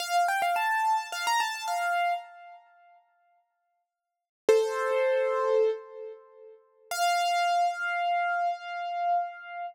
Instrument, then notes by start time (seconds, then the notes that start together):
acoustic grand piano
0.00 F5
0.28 G5
0.42 F5
0.56 A5
1.12 F5
1.27 A#5
1.40 A5
1.68 F5
4.49 A4 C5
6.91 F5